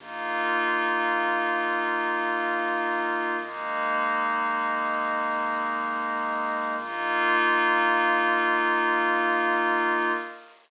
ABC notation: X:1
M:3/4
L:1/8
Q:1/4=53
K:Bbmix
V:1 name="Pad 5 (bowed)"
[B,EF]6 | [A,B,E]6 | [B,EF]6 |]
V:2 name="Pad 2 (warm)"
[Bef]6 | [ABe]6 | [Bef]6 |]
V:3 name="Synth Bass 2" clef=bass
B,,,2 B,,,4 | A,,,2 A,,,4 | B,,,6 |]